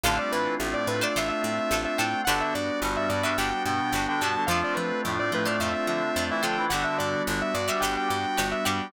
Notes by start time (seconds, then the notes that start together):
0.03 A1 D3 A3 C4 D4 F4 A4 C5 F5
0.19 G3 G4 D5
0.32 A2 E3 E4 B4
0.60 A1 A2 A3
0.74 D5
0.87 A2 B4
1.01 D4 F4 A4 C5 D5
1.16 A1 D4 F4 A4 C5 E5
1.29 E5
1.42 A2 E5
1.71 A1 D4 F4 A4 C5
1.85 E5
1.98 A2 D4 F4 A4 C5 G5
2.25 G1 D3 G3 B3 D4 F#4 G4 B4 F#5
2.29 D4
2.41 E5
2.55 G2 D5
2.82 G1 G2 G3
2.97 E5
3.09 G2 G3 D5
3.23 D4 F#4 G4 B4 E5
3.38 G1 D4 F#4 G4 B4 G5
3.50 G5
3.65 G2 B2 B3 G5
3.92 G1 D4 F#4 G4 B4
4.08 D3 D4 G5
4.21 G2 B2 B3 D4 F#4 G4 B4 A5
4.36 D3 D4
4.47 F2 F3 A3 C4 D4 F4 A4 C5 F5
4.51 D4
4.64 D5
4.74 F3 B4
5.05 F2 A2 A3
5.19 D5
5.32 A2 F3 A3 B4
5.45 D4 F4 A4 C5 D5
5.60 F2 D4 F4 A4 C5 E5
5.73 E5
5.87 D3 F3 D4 E5
6.16 F2 D4 F4 A4 C5
6.30 E3 E4 E5
6.42 D3 F3 D4 F4 A4 C5 G5
6.57 E3 E4
6.70 G1 D3 G3 B3 D4 F#4 G4 B4 F#5
6.74 D4
6.84 E5
6.98 G2 D5
7.27 G1 D3 D4
7.42 E5
7.54 G2 D5
7.68 G3 D4 F#4 G4 B4 E5
7.80 G1 F#4 G4 B4 G5
7.85 D4
7.97 G5
8.09 G2 G5
8.38 G1 D4 F#4 G4 B4
8.51 E5
8.65 G2 G3 D4 F#4 G4 B4 G5